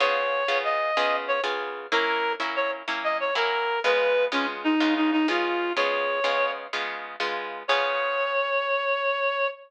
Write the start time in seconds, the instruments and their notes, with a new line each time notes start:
0.00 acoustic guitar (steel) C#3 B3 F4 G#4, clarinet C#5
0.48 acoustic guitar (steel) C#3 B3 F4 G#4
0.64 clarinet D#5
0.97 acoustic guitar (steel) C#3 B3 F4 G#4
1.28 clarinet C#5
1.43 acoustic guitar (steel) C#3 B3 F4 G#4
1.92 acoustic guitar (steel) F#3 A#3 C#4 E4, clarinet A#4
2.40 acoustic guitar (steel) F#3 A#3 C#4 E4
2.56 clarinet C#5
2.88 acoustic guitar (steel) F#3 A#3 C#4 E4
3.04 clarinet D#5
3.20 clarinet C#5
3.35 acoustic guitar (steel) F#3 A#3 C#4 E4, clarinet A#4
3.84 acoustic guitar (steel) C#3 G#3 B3 F4, clarinet B4
4.32 acoustic guitar (steel) C#3 G#3 B3 F4, clarinet C#4
4.64 clarinet D#4
4.80 acoustic guitar (steel) C#3 G#3 B3 F4
4.96 clarinet D#4
5.12 clarinet D#4
5.28 acoustic guitar (steel) C#3 G#3 B3 F4, clarinet F4
5.76 acoustic guitar (steel) C#3 G#3 B3 F4, clarinet C#5
6.24 acoustic guitar (steel) C#3 G#3 B3 F4
6.73 acoustic guitar (steel) C#3 G#3 B3 F4
7.20 acoustic guitar (steel) C#3 G#3 B3 F4
7.68 acoustic guitar (steel) C#3 B3 F4 G#4, clarinet C#5